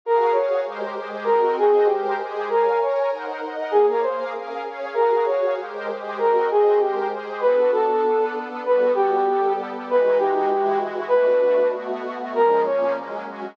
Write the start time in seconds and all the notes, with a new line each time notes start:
0.05 F#4 G#4 A#4 F5
0.32 F#4 G#4 C#5 F5
0.65 G#3 G4 A#4 C5
0.97 G#3 G4 G#4 C5
1.24 C4 F#4 A#4 D#5
1.57 C4 F#4 G#4 C5 D#5
1.86 G#3 G4 A#4 C5
2.19 G#3 G4 G#4 C5
2.49 A#4 C#5 F5 G#5
2.81 A#4 C#5 G#5 A#5
3.11 D#4 A#4 C5 F#5
3.42 D#4 A#4 D#5 F#5
3.71 A#3 G#4 C#5 F5
3.90 A#4
4.02 A#3 G#4 A#4 C5 F5
4.33 C#4 G#4 A#4 F5
4.65 C#4 G#4 C#5 F5
4.94 F#4 G#4 A#4 F5
5.26 F#4 G#4 C#5 F5
5.58 G#3 G4 A#4 C5
5.89 G#3 G4 G#4 C5
6.17 C4 F#4 A#4 D#5
6.50 C4 F#4 G#4 C5 D#5
6.79 G#3 G4 A#4 C5
7.11 G#3 G4 G#4 C5
7.41 B3 D4 F#4 A4 B4
7.72 A4
8.03 B3 D4 A4 B4
8.65 G3 B3 F#4 A4 B4
8.95 G4
9.27 G3 B3 G4 A4
9.88 E3 G#3 D#4 F#4 B4
10.18 G4
10.50 E3 G#3 E4 F#4
11.08 B2 A3 D4 F#4 B4
11.74 B2 A3 B3 F#4
12.33 A#2 F3 G#3 C#4 A#4
12.65 A#2 F3 A#3 C#4 C#5
12.96 F#3 G#3 A#3 C#4
13.26 F#3 G#3 C#4 F#4